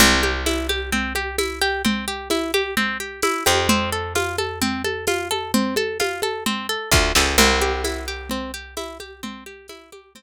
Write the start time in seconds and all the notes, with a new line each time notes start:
0.00 C2 C4, low conga
0.23 G4, high conga
0.46 E4, tambourine, high conga
0.69 G4, high conga
0.92 C4, low conga
1.15 G4, high conga
1.38 E4, tambourine, high conga
1.61 G4
1.85 C4, low conga
2.08 G4
2.30 E4, tambourine, high conga
2.54 G4, high conga
2.77 C4, low conga
3.00 G4
3.22 E4, tambourine, high conga
3.46 F2 G4, high conga
3.69 C4, low conga
3.92 A4
4.15 F4, tambourine, high conga
4.38 A4, high conga
4.62 C4, low conga
4.84 A4, high conga
5.07 F4, tambourine, high conga
5.31 A4, high conga
5.54 C4, low conga
5.76 A4, high conga
6.00 F4, tambourine, high conga
6.22 A4, high conga
6.46 C4, low conga
6.69 A4
6.91 D2 F4, kick, snare
7.15 C#2 A4, snare
7.38 C2 C4, crash, low conga
7.61 G4, high conga
7.84 E4, tambourine, high conga
8.08 G4
8.30 C4, low conga
8.54 G4
8.77 E4, tambourine, high conga
9.00 G4, high conga
9.23 C4, low conga
9.46 G4
9.68 E4, tambourine, high conga
9.92 G4, high conga
10.15 C4, low conga